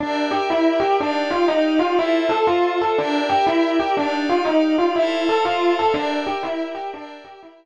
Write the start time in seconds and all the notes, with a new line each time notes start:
0.00 D4 G4 A#4 D5 E5
0.31 G4
0.50 E4
0.80 G4
1.00 D4 D#4 G4 D5 F5
1.30 F4
1.48 D#4
1.79 F4
1.96 E4 F4 A4 C5 E5
2.29 A4
2.47 F4
2.81 A4
2.98 D4 G4 A#4 D5 E5
3.29 G4
3.47 E4
3.80 G4
3.97 D4 D#4 G4 D5 F5
4.29 F4
4.45 D#4
4.78 F4
4.96 E4 A4 C5 E5 F5
5.29 A4
5.45 F4
5.79 A4
5.94 D4 G4 A#4 D5 E5
6.27 G4
6.43 E4
6.75 G4
6.94 D4 G4 A#4 D5 E5
7.24 G4
7.43 E4